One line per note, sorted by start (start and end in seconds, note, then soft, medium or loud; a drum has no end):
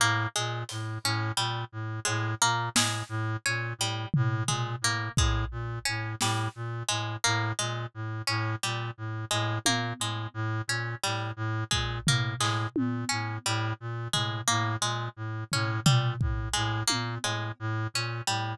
0.00 0.27 A2 medium
0.00 0.28 A#3 medium
0.36 0.64 A#2 medium
0.36 0.63 G#3 medium
0.69 0.98 A2 medium
0.69 closed hi-hat medium
1.04 1.32 A2 medium
1.04 1.33 C#4 medium
1.37 1.64 A#2 medium
1.37 1.65 G3 medium
1.72 2.00 A2 medium
2.05 2.35 A2 medium
2.05 2.33 G#3 medium
2.05 cowbell medium
2.42 2.69 A#2 medium
2.42 2.69 A#3 medium
2.75 3.03 A2 medium
2.75 3.04 G#3 medium
2.75 snare loud
3.09 3.37 A2 medium
3.46 3.74 A#2 medium
3.46 3.73 C#4 medium
3.78 4.06 A2 medium
3.78 4.08 G3 medium
4.14 4.43 A2 medium
4.14 floor tom loud
4.48 4.76 A#2 medium
4.48 4.76 G#3 medium
4.48 floor tom medium
4.81 5.09 A2 medium
4.81 5.12 A#3 medium
5.17 5.45 A2 medium
5.17 5.46 G#3 medium
5.17 kick medium
5.51 5.79 A#2 medium
5.85 6.15 A2 medium
5.85 6.13 C#4 medium
6.21 6.48 A2 medium
6.21 6.50 G3 medium
6.21 snare medium
6.55 6.83 A#2 medium
6.89 7.17 A2 medium
6.89 7.16 G#3 medium
7.24 7.53 A2 medium
7.24 7.52 A#3 medium
7.59 7.86 A#2 medium
7.59 7.86 G#3 medium
7.94 8.22 A2 medium
8.27 8.56 A2 medium
8.27 8.55 C#4 medium
8.63 8.91 A#2 medium
8.63 8.91 G3 medium
8.98 9.25 A2 medium
9.31 9.59 A2 medium
9.31 9.58 G#3 medium
9.66 9.93 A#2 medium
9.66 9.94 A#3 medium
9.66 high tom medium
10.00 10.27 A2 medium
10.00 10.29 G#3 medium
10.34 10.62 A2 medium
10.68 10.95 A#2 medium
10.68 10.97 C#4 medium
11.03 11.32 A2 medium
11.03 11.31 G3 medium
11.03 clap medium
11.36 11.64 A2 medium
11.71 12.00 A#2 medium
11.71 11.99 G#3 medium
11.71 kick medium
12.07 12.34 A2 medium
12.07 12.36 A#3 medium
12.07 floor tom loud
12.39 12.67 A2 medium
12.39 12.68 G#3 medium
12.39 clap medium
12.76 13.05 A#2 medium
12.76 high tom medium
13.09 13.38 A2 medium
13.09 13.37 C#4 medium
13.46 13.73 A2 medium
13.46 13.74 G3 medium
13.80 14.08 A#2 medium
14.13 14.41 A2 medium
14.13 14.41 G#3 medium
14.13 floor tom medium
14.48 14.77 A2 medium
14.48 14.75 A#3 medium
14.81 15.09 A#2 medium
14.81 15.09 G#3 medium
15.17 15.44 A2 medium
15.52 15.80 A2 medium
15.52 15.81 C#4 medium
15.52 floor tom medium
15.86 16.16 A#2 medium
15.86 16.14 G3 medium
15.86 floor tom loud
16.21 16.49 A2 medium
16.21 kick medium
16.53 16.83 A2 medium
16.53 16.81 G#3 medium
16.87 17.18 A#2 medium
16.87 17.15 A#3 medium
16.87 high tom medium
17.24 17.52 A2 medium
17.24 17.52 G#3 medium
17.24 cowbell medium
17.60 17.87 A2 medium
17.94 18.22 A#2 medium
17.94 18.23 C#4 medium
18.27 18.55 A2 medium
18.27 18.55 G3 medium